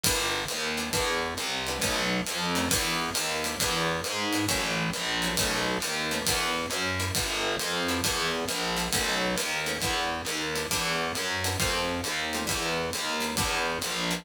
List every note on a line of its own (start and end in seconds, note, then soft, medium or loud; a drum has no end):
0.04 0.45 G1 loud
0.04 0.41 G3 loud
0.04 0.41 B3 medium
0.04 0.41 D4 medium
0.04 0.41 E4 medium
0.04 kick medium
0.04 ride loud
0.48 0.91 D#2 medium
0.48 hi-hat pedal medium
0.48 ride medium
0.77 0.89 G3 medium
0.77 0.89 B3 medium
0.77 0.89 D4 medium
0.77 0.89 E4 medium
0.77 ride medium
0.93 1.34 E2 medium
0.93 1.28 G3 medium
0.93 1.28 B3 medium
0.93 1.28 D4 medium
0.93 1.28 E4 medium
0.93 kick medium
0.93 ride medium
1.37 1.79 C2 medium
1.37 hi-hat pedal medium
1.37 ride medium
1.67 1.79 G3 medium
1.67 1.79 B3 medium
1.67 1.79 D4 medium
1.67 1.79 E4 medium
1.67 ride medium
1.80 2.21 B1 loud
1.80 2.17 A3 medium
1.80 2.17 B3 medium
1.80 2.17 C#4 medium
1.80 2.17 D#4 medium
1.80 kick medium
1.80 ride medium
2.26 2.69 F2 medium
2.26 hi-hat pedal medium
2.26 ride medium
2.55 2.67 A3 medium
2.55 2.67 B3 medium
2.55 2.67 C#4 medium
2.55 2.67 D#4 medium
2.55 ride medium
2.69 3.10 E2 loud
2.69 3.06 G3 medium
2.69 3.06 B3 medium
2.69 3.06 D4 medium
2.69 3.06 E4 medium
2.69 kick medium
2.69 ride loud
3.14 3.56 D#2 medium
3.14 hi-hat pedal medium
3.14 ride medium
3.44 3.56 G3 medium
3.44 3.56 B3 medium
3.44 3.56 D4 medium
3.44 3.56 E4 medium
3.44 ride medium
3.60 4.01 E2 medium
3.60 3.96 G3 medium
3.60 3.96 B3 medium
3.60 3.96 D4 medium
3.60 3.96 E4 medium
3.60 kick medium
3.60 ride medium
4.04 4.46 G#2 medium
4.04 hi-hat pedal medium
4.04 ride medium
4.33 4.44 G3 medium
4.33 4.44 B3 medium
4.33 4.44 D4 medium
4.33 4.44 E4 medium
4.33 ride medium
4.48 4.90 A1 loud
4.48 4.84 F#3 loud
4.48 4.84 A3 medium
4.48 4.84 C#4 medium
4.48 4.84 E4 medium
4.48 kick medium
4.48 ride medium
4.93 5.36 A#1 medium
4.93 hi-hat pedal medium
4.93 ride medium
5.22 5.34 F#3 medium
5.22 5.34 A3 medium
5.22 5.34 C#4 medium
5.22 5.34 E4 medium
5.22 ride medium
5.36 5.78 B1 loud
5.36 5.74 A3 medium
5.36 5.74 B3 medium
5.36 5.74 C#4 medium
5.36 5.74 D#4 medium
5.36 kick medium
5.36 ride loud
5.80 6.22 D#2 medium
5.80 hi-hat pedal medium
5.80 ride medium
6.11 6.22 A3 medium
6.11 6.22 B3 medium
6.11 6.22 C#4 medium
6.11 6.22 D#4 medium
6.11 ride medium
6.25 6.66 E2 loud
6.25 6.63 G3 medium
6.25 6.63 B3 medium
6.25 6.63 D4 medium
6.25 6.63 E4 medium
6.25 kick medium
6.25 ride loud
6.70 7.11 F#2 medium
6.70 hi-hat pedal medium
6.70 ride medium
7.00 7.10 G3 medium
7.00 7.10 B3 medium
7.00 7.10 D4 medium
7.00 7.10 E4 medium
7.00 ride medium
7.15 7.56 G1 loud
7.15 7.51 G3 medium
7.15 7.51 B3 medium
7.15 7.51 D4 medium
7.15 7.51 E4 medium
7.15 kick medium
7.15 ride medium
7.60 8.01 F2 medium
7.60 hi-hat pedal medium
7.60 ride medium
7.89 8.00 G3 medium
7.89 8.00 B3 medium
7.89 8.00 D4 medium
7.89 8.00 E4 medium
7.89 ride medium
8.04 8.45 E2 loud
8.04 8.39 G3 medium
8.04 8.39 B3 medium
8.04 8.39 D4 medium
8.04 8.39 E4 medium
8.04 kick medium
8.04 ride medium
8.48 8.89 A#1 medium
8.48 hi-hat pedal medium
8.48 ride medium
8.76 8.87 G3 medium
8.76 8.87 B3 medium
8.76 8.87 D4 medium
8.76 8.87 E4 medium
8.76 ride medium
8.93 9.36 B1 medium
8.93 9.28 A3 medium
8.93 9.28 B3 medium
8.93 9.28 C#4 medium
8.93 9.28 D#4 medium
8.93 kick medium
8.93 ride loud
9.36 9.78 D#2 medium
9.36 hi-hat pedal medium
9.36 ride medium
9.66 9.77 A3 medium
9.66 9.77 B3 medium
9.66 9.77 C#4 medium
9.66 9.77 D#4 medium
9.66 ride medium
9.80 10.22 E2 medium
9.80 10.17 G3 medium
9.80 10.17 B3 medium
9.80 10.17 D4 medium
9.80 10.17 E4 medium
9.80 kick medium
9.80 ride medium
10.25 10.66 D#2 medium
10.25 hi-hat pedal medium
10.25 ride medium
10.55 10.66 G3 medium
10.55 10.66 B3 medium
10.55 10.66 D4 medium
10.55 10.66 E4 medium
10.55 ride medium
10.71 11.12 E2 loud
10.71 11.06 G3 medium
10.71 11.06 B3 medium
10.71 11.06 D4 medium
10.71 11.06 E4 medium
10.71 kick soft
10.71 ride medium
11.15 11.56 F#2 medium
11.15 hi-hat pedal medium
11.15 ride medium
11.44 11.55 G3 medium
11.44 11.55 B3 medium
11.44 11.55 D4 medium
11.44 11.55 E4 medium
11.44 ride medium
11.59 12.01 F2 loud
11.59 11.95 G3 medium
11.59 11.95 A3 medium
11.59 11.95 C4 medium
11.59 11.95 F4 medium
11.59 kick medium
11.59 ride medium
12.04 12.45 D#2 medium
12.04 hi-hat pedal medium
12.04 ride medium
12.33 12.45 G3 medium
12.33 12.45 A3 medium
12.33 12.45 C4 medium
12.33 12.45 F4 medium
12.33 ride medium
12.47 12.90 E2 loud
12.47 12.82 G3 medium
12.47 12.82 B3 medium
12.47 12.82 D4 medium
12.47 12.82 E4 medium
12.47 kick medium
12.47 ride medium
12.93 13.35 D#2 medium
12.93 hi-hat pedal medium
12.93 ride medium
13.20 13.31 G3 medium
13.20 13.31 B3 medium
13.20 13.31 D4 medium
13.20 13.31 E4 medium
13.20 ride medium
13.37 13.78 E2 loud
13.37 13.73 G3 medium
13.37 13.73 B3 medium
13.37 13.73 D4 medium
13.37 13.73 E4 medium
13.37 kick medium
13.37 ride medium
13.82 14.24 A#1 medium
13.82 hi-hat pedal medium
13.82 ride medium
14.11 14.21 G3 medium
14.11 14.21 B3 medium
14.11 14.21 D4 medium
14.11 14.21 E4 medium
14.11 ride medium